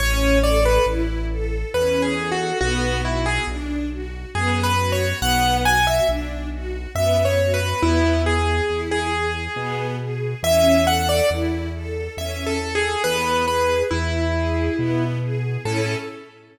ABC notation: X:1
M:3/4
L:1/16
Q:1/4=69
K:A
V:1 name="Acoustic Grand Piano"
c2 d B z4 (3B2 G2 F2 | F2 E G z4 (3G2 B2 c2 | f2 g e z4 (3e2 c2 B2 | E2 G3 G5 z2 |
e2 f d z4 (3e2 A2 G2 | B2 B2 E6 z2 | A4 z8 |]
V:2 name="String Ensemble 1"
C2 A2 E2 A2 C2 A2 | B,2 F2 D2 F2 B,2 F2 | B,2 F2 D2 F2 B,2 F2 | B,2 G2 E2 G2 B,2 G2 |
C2 A2 E2 A2 C2 A2 | B,2 G2 E2 G2 B,2 G2 | [CEA]4 z8 |]
V:3 name="Acoustic Grand Piano" clef=bass
A,,,4 A,,,4 E,,4 | B,,,4 B,,,4 F,,4 | B,,,4 B,,,4 F,,4 | E,,4 E,,4 B,,4 |
E,,4 E,,4 E,,4 | E,,4 E,,4 B,,4 | A,,4 z8 |]